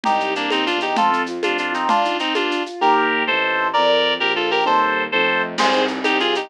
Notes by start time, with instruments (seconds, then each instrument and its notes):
0.03 violin C2, clarinet D#4 G4, low conga, shaker
0.20 shaker
0.35 clarinet A#3 D4, shaker
0.50 violin D#2, clarinet C4 D#4, high conga, shaker
0.66 clarinet D4 F4, shaker
0.74 violin E2
0.80 clarinet D#4 G4, shaker
0.96 violin F2, acoustic grand piano A3, clarinet F4 A4, low conga, shaker
1.11 acoustic grand piano C4, shaker
1.26 acoustic grand piano F4, shaker
1.43 violin F2, acoustic grand piano A3, clarinet D4 F4, high conga, shaker
1.57 acoustic grand piano C4, clarinet D4 F4, shaker
1.72 clarinet C4 D#4, acoustic grand piano F4, shaker
1.89 acoustic grand piano A#3, clarinet D4 F4, low conga, shaker
2.05 acoustic grand piano D#4, shaker
2.19 clarinet C4 D#4, acoustic grand piano F4, shaker
2.35 acoustic grand piano A#3, clarinet D4 F4, high conga, shaker
2.50 acoustic grand piano D4, shaker
2.66 acoustic grand piano F4, shaker
2.81 violin D#2, acoustic grand piano A#3 D#4 G4, clarinet G4 A#4
3.27 violin A1, acoustic grand piano A3 C4 D#4, clarinet A4 C5
3.73 violin F2, clarinet A#4 D5
4.19 violin A#1, clarinet G4 A#4
4.36 clarinet F4 A4
4.51 clarinet G4 A#4
4.65 violin D#2, acoustic grand piano G3 C4 D#4, clarinet A4 C5
5.12 violin F2, acoustic grand piano F3 A3 C4 D#4, clarinet A4 C5
5.58 violin C2, acoustic grand piano C4, clarinet G#4 C5, crash, low conga, shaker
5.72 acoustic grand piano D#4, shaker
5.88 acoustic grand piano G4, shaker
6.04 violin C2, acoustic grand piano D#4, clarinet D#4 G4, high conga, shaker
6.19 acoustic grand piano C4, clarinet F4 G#4, shaker
6.35 acoustic grand piano D#4, clarinet D#4 G4, shaker